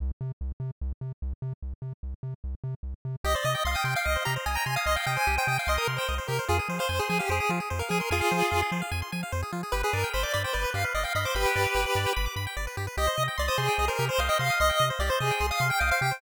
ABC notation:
X:1
M:4/4
L:1/16
Q:1/4=148
K:Cm
V:1 name="Lead 1 (square)"
z16 | z16 | e d e2 f g g f e2 b z a b a f | e f g a2 g g f e B z c2 z B2 |
A z2 c2 A A G A2 z3 B A B | [FA]6 z10 | =B A _B2 c d d c =B2 f z e f e c | [G=B]8 z8 |
e3 z d c A3 B2 c f e f2 | e3 z d c A3 f2 g f f g2 |]
V:2 name="Lead 1 (square)"
z16 | z16 | G c e g c' e' c' g e c G c e g c' e' | c' g e c G c e g c' e' c' g e c G c |
F A c f a c' a f c A F A c f a c' | a f c A F A c f a c' a f c A F A | G =B d g =b d' b g d B G B d g b d' | =b g d =B G B d g b d' b g d B G B |
G c e g c' e' c' g e c G c e g c' e' | c' g e c G c e g c' e' c' g e c G c |]
V:3 name="Synth Bass 1" clef=bass
C,,2 C,2 C,,2 C,2 C,,2 C,2 C,,2 C,2 | C,,2 C,2 C,,2 C,2 C,,2 C,2 C,,2 C,2 | C,,2 C,2 C,,2 C,2 C,,2 C,2 C,,2 C,2 | C,,2 C,2 C,,2 C,2 C,,2 C,2 C,,2 C,2 |
F,,2 F,2 F,,2 F,2 F,,2 F,2 F,,2 F,2 | F,,2 F,2 F,,2 F,2 F,,2 F,2 F,,2 F,2 | G,,,2 G,,2 G,,,2 G,,2 G,,,2 G,,2 G,,,2 G,,2 | G,,,2 G,,2 G,,,2 G,,2 G,,,2 G,,2 G,,,2 G,,2 |
C,,2 C,2 C,,2 C,2 C,,2 C,2 C,,2 C,2 | C,,2 C,2 C,,2 C,2 C,,2 C,2 C,,2 C,2 |]